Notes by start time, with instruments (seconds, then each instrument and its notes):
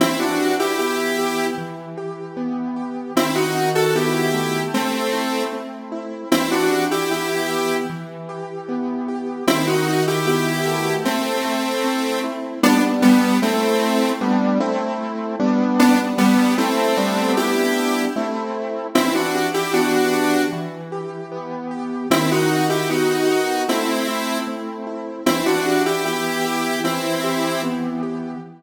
0.00 acoustic grand piano E3, lead 1 (square) C4 E4
0.19 lead 1 (square) D4 F#4
0.39 acoustic grand piano G4
0.59 lead 1 (square) E4 G4
0.79 acoustic grand piano B3, lead 1 (square) E4 G4
1.18 acoustic grand piano G4
1.58 acoustic grand piano E3
1.98 acoustic grand piano G4
2.37 acoustic grand piano B3
2.76 acoustic grand piano G4
3.15 acoustic grand piano D#3, lead 1 (square) C4 E4
3.35 lead 1 (square) D#4 F#4
3.55 acoustic grand piano F#4
3.75 lead 1 (square) F#4 A4
3.95 acoustic grand piano B3, lead 1 (square) E4 G4
4.34 acoustic grand piano A3
4.74 lead 1 (square) A3 C4
5.13 acoustic grand piano E4
5.53 acoustic grand piano C4
5.92 acoustic grand piano E4
6.32 acoustic grand piano E3, lead 1 (square) C4 E4
6.51 lead 1 (square) D4 F#4
6.71 acoustic grand piano G4
6.91 lead 1 (square) E4 G4
7.11 acoustic grand piano B3, lead 1 (square) E4 G4
7.50 acoustic grand piano G4
7.90 acoustic grand piano E3
8.29 acoustic grand piano G4
8.69 acoustic grand piano B3
9.08 acoustic grand piano G4
9.47 acoustic grand piano D#3, lead 1 (square) C4 E4
9.67 lead 1 (square) D#4 F#4
9.87 acoustic grand piano F#4
10.07 lead 1 (square) E4 G4
10.26 acoustic grand piano B3, lead 1 (square) E4 G4
10.66 acoustic grand piano A3
11.05 lead 1 (square) A3 C4
11.45 acoustic grand piano E4
11.84 acoustic grand piano C4
12.24 acoustic grand piano E4
12.63 acoustic grand piano G3 B3 D4, lead 1 (square) B3 D4
13.02 lead 1 (square) G3 B3
13.42 lead 1 (square) A3 C4, acoustic grand piano A3 C4 E4
14.21 acoustic grand piano G3 B3 D4
14.60 acoustic grand piano A3 C4 E4
15.40 acoustic grand piano G3 B3 D4
15.79 lead 1 (square) B3 D4
16.18 lead 1 (square) G3 B3
16.58 acoustic grand piano A3 C4 E4, lead 1 (square) A3 C4
16.97 acoustic grand piano G3 B3 D4
17.37 lead 1 (square) E4 G4
18.16 acoustic grand piano A3 C4 E4
18.95 acoustic grand piano E3, lead 1 (square) C4 E4
19.14 lead 1 (square) D4 F#4
19.34 acoustic grand piano G4
19.54 lead 1 (square) E4 G4
19.73 acoustic grand piano B3, lead 1 (square) D4 F#4
20.13 acoustic grand piano G4
20.53 acoustic grand piano E3
20.92 acoustic grand piano G4
21.32 acoustic grand piano B3
21.71 acoustic grand piano G4
22.10 acoustic grand piano D#3, lead 1 (square) C4 E4
22.31 lead 1 (square) D#4 F#4
22.50 acoustic grand piano F#4
22.69 lead 1 (square) E4 G4
22.89 acoustic grand piano B3, lead 1 (square) D#4 F#4
23.29 acoustic grand piano F#4
23.68 acoustic grand piano A3, lead 1 (square) C4 E4
24.08 acoustic grand piano E4
24.47 acoustic grand piano C4
24.87 acoustic grand piano E4
25.26 acoustic grand piano E3, lead 1 (square) C4 E4
25.46 lead 1 (square) D4 F#4
25.66 acoustic grand piano G4
25.86 lead 1 (square) E4 G4
26.05 acoustic grand piano B3, lead 1 (square) E4 G4
26.45 acoustic grand piano G4
26.84 acoustic grand piano E3, lead 1 (square) C4 E4
27.24 acoustic grand piano G4
27.63 acoustic grand piano B3
28.03 acoustic grand piano G4